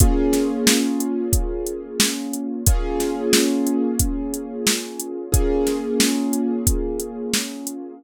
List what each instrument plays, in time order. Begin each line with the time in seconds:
0.00 acoustic grand piano A#3 C#4 F4 G#4, kick, closed hi-hat
0.33 snare, closed hi-hat
0.67 snare
1.00 closed hi-hat
1.33 kick, closed hi-hat
1.67 closed hi-hat
2.00 snare
2.33 closed hi-hat
2.66 acoustic grand piano A#3 C#4 F4 G#4, kick, closed hi-hat
3.00 snare, closed hi-hat
3.33 snare
3.67 closed hi-hat
3.99 kick, closed hi-hat
4.34 closed hi-hat
4.67 snare
5.00 closed hi-hat
5.32 acoustic grand piano A#3 C#4 F4 G#4, kick, closed hi-hat
5.67 snare, closed hi-hat
6.00 snare
6.33 closed hi-hat
6.67 kick, closed hi-hat
7.00 closed hi-hat
7.33 snare
7.67 closed hi-hat